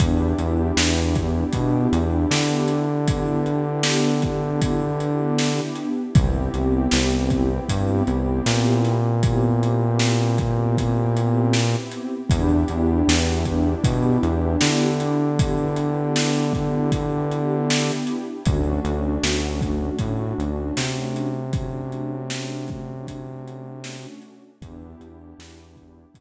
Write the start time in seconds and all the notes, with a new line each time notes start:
0.00 E2 B3 D4 E4 G4, kick, closed hi-hat
0.38 E2, closed hi-hat
0.77 E2, snare
1.15 kick, closed hi-hat
1.53 B2, kick, closed hi-hat
1.92 E2, closed hi-hat
2.31 D3, snare
2.68 closed hi-hat
3.08 B3 D4 E4 G4, kick, closed hi-hat
3.46 closed hi-hat
3.83 snare
4.22 kick, closed hi-hat
4.62 kick, closed hi-hat
5.00 closed hi-hat
5.38 snare
5.75 closed hi-hat
6.15 C2 B3 C4 E4 G4, kick, closed hi-hat
6.54 C2, closed hi-hat
6.91 C2, snare
7.30 kick, closed hi-hat
7.69 G2, kick, closed hi-hat
8.07 C2, closed hi-hat
8.46 A#2, snare
8.84 snare, closed hi-hat
9.23 B3 C4 E4 G4, kick, closed hi-hat
9.63 closed hi-hat
9.99 snare
10.38 kick, closed hi-hat
10.78 kick, closed hi-hat
11.17 closed hi-hat
11.53 snare
11.92 closed hi-hat
12.30 E2 B3 D4 E4 G4, kick, closed hi-hat
12.68 E2, closed hi-hat
13.08 E2, snare
13.45 kick, closed hi-hat
13.84 B2, kick, closed hi-hat
14.23 E2, closed hi-hat
14.61 D3, snare
15.00 closed hi-hat
15.39 B3 D4 E4 G4, kick, closed hi-hat
15.76 closed hi-hat
16.16 snare
16.54 kick, closed hi-hat
16.92 kick, closed hi-hat
17.32 closed hi-hat
17.70 snare
18.07 closed hi-hat
18.46 D2 A3 C#4 D4 F#4, kick, closed hi-hat
18.85 D2, closed hi-hat
19.23 D2, snare
19.61 kick, closed hi-hat
19.99 A2, kick, closed hi-hat
20.38 D2, closed hi-hat
20.77 C3, snare
21.16 closed hi-hat
21.53 A3 C#4 D4 F#4, kick, closed hi-hat
21.92 closed hi-hat
22.30 snare
22.68 kick, closed hi-hat
23.07 kick, closed hi-hat
23.48 closed hi-hat
23.84 snare
24.22 closed hi-hat
24.62 E2 B3 D4 E4 G4, kick, closed hi-hat
25.00 E2, closed hi-hat
25.38 E2, snare
25.76 kick, closed hi-hat
26.14 B2 B3 D4 E4 G4, kick, closed hi-hat